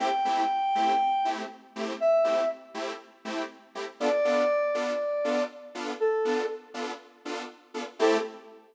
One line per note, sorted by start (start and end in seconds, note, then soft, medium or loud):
0.00 0.08 A3 medium
0.00 0.08 C4 medium
0.00 0.08 E4 medium
0.00 0.08 G4 medium
0.00 1.29 G5 medium
0.25 0.42 A3 medium
0.25 0.42 C4 medium
0.25 0.42 E4 medium
0.25 0.42 G4 medium
0.75 0.93 A3 medium
0.75 0.93 C4 medium
0.75 0.93 E4 medium
0.75 0.93 G4 medium
1.25 1.42 A3 medium
1.25 1.42 C4 medium
1.25 1.42 E4 medium
1.25 1.42 G4 medium
1.76 1.93 A3 medium
1.76 1.93 C4 medium
1.76 1.93 E4 medium
1.76 1.93 G4 medium
2.00 2.49 E5 medium
2.24 2.42 A3 medium
2.24 2.42 C4 medium
2.24 2.42 E4 medium
2.24 2.42 G4 medium
2.74 2.92 A3 medium
2.74 2.92 C4 medium
2.74 2.92 E4 medium
2.74 2.92 G4 medium
3.25 3.42 A3 medium
3.25 3.42 C4 medium
3.25 3.42 E4 medium
3.25 3.42 G4 medium
3.75 3.84 A3 medium
3.75 3.84 C4 medium
3.75 3.84 E4 medium
3.75 3.84 G4 medium
4.00 4.09 B3 medium
4.00 4.09 D4 medium
4.00 4.09 F4 medium
4.00 4.09 A4 medium
4.00 5.42 D5 medium
4.25 4.42 B3 medium
4.25 4.42 D4 medium
4.25 4.42 F4 medium
4.25 4.42 A4 medium
4.74 4.92 B3 medium
4.74 4.92 D4 medium
4.74 4.92 F4 medium
4.74 4.92 A4 medium
5.24 5.42 B3 medium
5.24 5.42 D4 medium
5.24 5.42 F4 medium
5.24 5.42 A4 medium
5.75 5.92 B3 medium
5.75 5.92 D4 medium
5.75 5.92 F4 medium
5.75 5.92 A4 medium
6.00 6.46 A4 medium
6.25 6.42 B3 medium
6.25 6.42 D4 medium
6.25 6.42 F4 medium
6.25 6.42 A4 medium
6.74 6.91 B3 medium
6.74 6.91 D4 medium
6.74 6.91 F4 medium
6.74 6.91 A4 medium
7.25 7.43 B3 medium
7.25 7.43 D4 medium
7.25 7.43 F4 medium
7.25 7.43 A4 medium
7.74 7.83 B3 medium
7.74 7.83 D4 medium
7.74 7.83 F4 medium
7.74 7.83 A4 medium
7.99 8.17 A3 loud
7.99 8.17 C4 medium
7.99 8.17 E4 loud
7.99 8.17 G4 loud
7.99 8.18 A4 loud